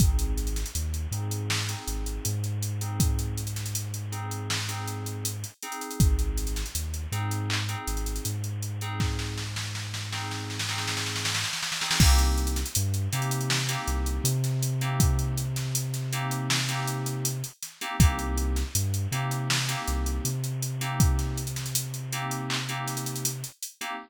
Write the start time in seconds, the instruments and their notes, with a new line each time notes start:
0.00 synth bass 2 G#1, electric piano 2 C4 D#4 G#4, kick, closed hi-hat
0.19 closed hi-hat
0.38 closed hi-hat
0.47 closed hi-hat
0.56 snare, closed hi-hat
0.66 closed hi-hat
0.75 synth bass 2 D#2, closed hi-hat
0.94 closed hi-hat
1.11 synth bass 2 G#2, electric piano 2 C4 D#4 G#4, closed hi-hat
1.31 closed hi-hat
1.50 snare
1.69 electric piano 2 C4 D#4 G#4, snare, closed hi-hat
1.87 synth bass 2 G#1, closed hi-hat
2.06 closed hi-hat
2.25 synth bass 2 G#2, closed hi-hat
2.44 closed hi-hat
2.62 closed hi-hat
2.81 electric piano 2 C4 D#4 G#4, closed hi-hat
3.00 kick, closed hi-hat
3.19 closed hi-hat
3.38 closed hi-hat
3.47 closed hi-hat
3.56 snare, closed hi-hat
3.66 closed hi-hat
3.75 closed hi-hat
3.94 closed hi-hat
4.12 electric piano 2 C4 D#4 G#4, closed hi-hat
4.31 closed hi-hat
4.50 snare
4.68 electric piano 2 C4 D#4 G#4, closed hi-hat
4.88 closed hi-hat
5.06 closed hi-hat
5.25 closed hi-hat
5.44 closed hi-hat
5.62 electric piano 2 C4 D#4 G#4, closed hi-hat
5.72 closed hi-hat
5.81 closed hi-hat
5.91 closed hi-hat
6.00 synth bass 2 G#1, kick, closed hi-hat
6.19 closed hi-hat
6.38 closed hi-hat
6.47 closed hi-hat
6.56 snare, closed hi-hat
6.66 closed hi-hat
6.75 synth bass 2 D#2, closed hi-hat
6.94 closed hi-hat
7.12 synth bass 2 G#2, electric piano 2 C4 D#4 G#4, closed hi-hat
7.31 closed hi-hat
7.50 clap
7.69 electric piano 2 C4 D#4 G#4, closed hi-hat
7.87 synth bass 2 G#1, closed hi-hat
7.97 closed hi-hat
8.06 closed hi-hat
8.16 closed hi-hat
8.25 synth bass 2 G#2, closed hi-hat
8.44 closed hi-hat
8.62 closed hi-hat
8.81 electric piano 2 C4 D#4 G#4, closed hi-hat
9.00 kick, snare
9.19 snare
9.38 snare
9.56 snare
9.75 snare
9.94 snare
10.12 electric piano 2 C4 D#4 G#4, snare
10.31 snare
10.50 snare
10.59 snare
10.69 electric piano 2 C4 D#4 G#4, snare
10.78 snare
10.88 snare
10.97 snare
11.06 snare
11.16 snare
11.25 snare
11.34 snare
11.44 snare
11.53 snare
11.62 snare
11.72 snare
11.81 electric piano 2 C4 D#4 G#4, snare
11.91 snare
12.00 synth bass 2 C2, electric piano 2 A#3 C4 D#4 G4, kick, crash
12.19 snare, closed hi-hat
12.38 closed hi-hat
12.47 closed hi-hat
12.56 snare, closed hi-hat
12.66 closed hi-hat
12.75 synth bass 2 G2, closed hi-hat
12.94 closed hi-hat
13.12 synth bass 2 C3, electric piano 2 A#3 C4 D#4 G4, closed hi-hat
13.22 closed hi-hat
13.31 closed hi-hat
13.41 closed hi-hat
13.50 snare
13.69 electric piano 2 A#3 C4 D#4 G4, closed hi-hat
13.88 synth bass 2 C2, closed hi-hat
14.06 closed hi-hat
14.24 synth bass 2 C3, closed hi-hat
14.44 snare, closed hi-hat
14.62 closed hi-hat
14.81 electric piano 2 A#3 C4 D#4 G4, closed hi-hat
15.00 kick, closed hi-hat
15.19 closed hi-hat
15.38 closed hi-hat
15.56 snare, closed hi-hat
15.75 closed hi-hat
15.94 snare, closed hi-hat
16.12 electric piano 2 A#3 C4 D#4 G4, closed hi-hat
16.31 closed hi-hat
16.50 snare
16.69 electric piano 2 A#3 C4 D#4 G4, closed hi-hat
16.88 closed hi-hat
17.06 closed hi-hat
17.25 closed hi-hat
17.44 closed hi-hat
17.62 snare, closed hi-hat
17.81 electric piano 2 A#3 C4 D#4 G4, closed hi-hat
18.00 synth bass 2 C2, electric piano 2 A#3 C4 D#4 G4, kick, closed hi-hat
18.19 closed hi-hat
18.38 closed hi-hat
18.56 snare, closed hi-hat
18.75 synth bass 2 G2, closed hi-hat
18.94 closed hi-hat
19.12 synth bass 2 C3, electric piano 2 A#3 C4 D#4 G4, closed hi-hat
19.31 closed hi-hat
19.50 snare
19.68 electric piano 2 A#3 C4 D#4 G4, closed hi-hat
19.88 synth bass 2 C2, closed hi-hat
20.06 closed hi-hat
20.25 synth bass 2 C3, closed hi-hat
20.44 closed hi-hat
20.62 closed hi-hat
20.81 electric piano 2 A#3 C4 D#4 G4, closed hi-hat
21.00 kick, closed hi-hat
21.19 snare, closed hi-hat
21.38 closed hi-hat
21.47 closed hi-hat
21.56 snare, closed hi-hat
21.66 closed hi-hat
21.75 closed hi-hat
21.94 closed hi-hat
22.12 electric piano 2 A#3 C4 D#4 G4, closed hi-hat
22.31 closed hi-hat
22.50 clap
22.69 electric piano 2 A#3 C4 D#4 G4, closed hi-hat
22.88 snare, closed hi-hat
22.97 closed hi-hat
23.06 closed hi-hat
23.16 closed hi-hat
23.25 closed hi-hat
23.44 closed hi-hat
23.62 closed hi-hat
23.81 electric piano 2 A#3 C4 D#4 G4, closed hi-hat